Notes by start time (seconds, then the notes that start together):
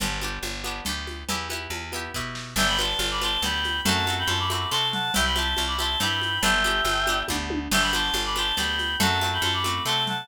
0.00 G1 B3 D4 G4, cowbell, low conga, shaker
0.21 B3 D4 G4, high conga, shaker
0.43 G1, cowbell, high conga, shaker
0.64 B3 D4 G4, high conga, shaker
0.85 D2 B3 D4 G4, cowbell, low conga, shaker
1.07 high conga, shaker
1.29 E2 B3 E4 G4, cowbell, low conga, shaker
1.50 B3 E4 G4, high conga, shaker
1.70 E2, cowbell, high conga, shaker
1.92 B3 E4 G4, high conga, shaker
2.14 B2 B3 E4 G4, kick, snare
2.35 snare
2.56 G1 B3 D4 E5 G5, crash, cowbell, low conga, shaker
2.60 G4
2.68 G5 B5
2.79 B3 D4 G4 A5 C6, high conga, shaker
2.99 G1, cowbell, high conga, shaker
3.11 B5 D6
3.21 B3 D4 G4 A5 C6, high conga, shaker
3.42 D2 B3 D4 G4 G5 B5, cowbell, low conga, shaker
3.64 high conga, shaker
3.85 F#2 A3 C4 F#4 F#5 A5, cowbell, low conga, shaker
4.07 A3 C4 F#4, high conga, shaker
4.18 G5 B5
4.27 F#2 A5 C6, cowbell, high conga, shaker
4.39 B5 D6
4.50 A3 C4 F#4 B5 D6, high conga, shaker
4.70 C3 A3 C4 F#4 A5 C6, cowbell
4.93 F#5 A5, low conga, shaker
5.14 C2 C4 E4 G4 E5 G5, cowbell, low conga, shaker
5.25 G5 B5
5.36 C4 E4 G4 A5 C6, high conga, shaker
5.57 C2, cowbell, high conga, shaker
5.67 B5 D6
5.78 C4 E4 G4 A5 C6, high conga, shaker
6.00 G2 C4 E4 G4 G5 B5, cowbell, low conga, shaker
6.22 high conga, shaker
6.42 G1 B3 D4 G4 E5 G5, cowbell, low conga, shaker
6.64 B3 D4 G4, high conga, shaker
6.85 G1, cowbell, high conga, shaker
7.07 B3 D4 G4, high conga, shaker
7.28 D2 B3 D4 G4, kick, high tom
7.50 high tom
7.71 G1 B3 D4 G4 E5 G5, crash, cowbell, low conga, shaker
7.81 G5 B5
7.93 B3 D4 G4 A5 C6, high conga, shaker
8.14 G1, cowbell, high conga, shaker
8.25 B5 D6
8.36 B3 D4 G4 A5 C6, high conga, shaker
8.56 D2 B3 D4 G4 G5 B5, cowbell, low conga, shaker
8.79 high conga, shaker
9.00 F#2 A3 C4 F#4 F#5 A5, cowbell, low conga, shaker
9.21 A3 C4 F#4, high conga, shaker
9.33 G5 B5
9.42 F#2 A5 C6, cowbell, high conga, shaker
9.53 B5 D6
9.64 A3 C4 F#4 B5 D6, high conga, shaker
9.85 C3 A3 C4 F#4 A5 C6, cowbell
10.07 F#5 A5, low conga, shaker